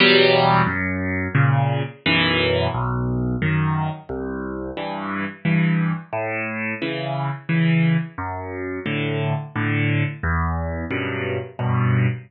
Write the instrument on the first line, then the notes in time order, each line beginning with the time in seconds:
acoustic grand piano
0.00 E2 B2 F#3 G3
0.66 F#2
1.35 A#2 C#3
2.06 B1 F#2 E3
2.74 B1
3.42 F#2 D#3
4.09 C2
4.77 G2 E3
5.45 G2 E3
6.13 A2
6.82 C#3 E3
7.49 C#3 E3
8.18 F#2
8.86 A2 D3
9.56 A2 D3
10.23 E2
10.91 F#2 G2 B2
11.59 F#2 G2 B2